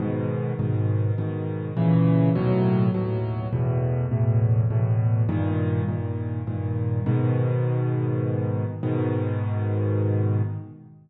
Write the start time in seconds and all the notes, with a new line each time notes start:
0.00 G#2 B2 D#3
0.59 G#2 B2 D#3
1.18 G#2 B2 D#3
1.77 A#2 C#3 E3
2.35 D#2 A2 B2 F#3
2.94 D#2 A2 B2 F#3
3.53 E2 A2 B2
4.11 E2 A2 B2
4.70 E2 A2 B2
5.29 G2 A#2 D#3
5.88 G2 A#2 D#3
6.47 G2 A#2 D#3
7.06 G#2 B2 D#3
8.83 G#2 B2 D#3